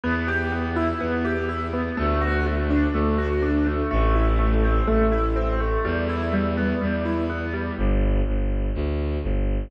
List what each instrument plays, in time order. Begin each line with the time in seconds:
0.04 violin E2, acoustic grand piano B3
0.28 acoustic grand piano G4
0.52 acoustic grand piano B3
0.76 acoustic grand piano E4
1.01 violin E2, acoustic grand piano B3
1.25 acoustic grand piano G4
1.49 acoustic grand piano E4
1.73 acoustic grand piano B3
1.97 violin D2, acoustic grand piano A3
2.21 acoustic grand piano F#4
2.46 acoustic grand piano A3
2.70 acoustic grand piano D4
2.94 violin D2, acoustic grand piano A3
3.18 acoustic grand piano F#4
3.42 acoustic grand piano D4
3.66 acoustic grand piano A3
3.91 violin A1, acoustic grand piano A3
4.15 acoustic grand piano E4
4.39 acoustic grand piano A3
4.63 acoustic grand piano C4
4.88 violin A1, acoustic grand piano A3
5.12 acoustic grand piano E4
5.36 acoustic grand piano C4
5.60 acoustic grand piano A3
5.85 violin E2, acoustic grand piano G3
6.09 acoustic grand piano E4
6.33 acoustic grand piano G3
6.57 acoustic grand piano B3
6.81 violin E2, acoustic grand piano G3
7.05 acoustic grand piano E4
7.30 acoustic grand piano B3
7.54 acoustic grand piano G3
7.78 violin G1
8.27 violin G1
8.75 violin D2
9.23 violin G1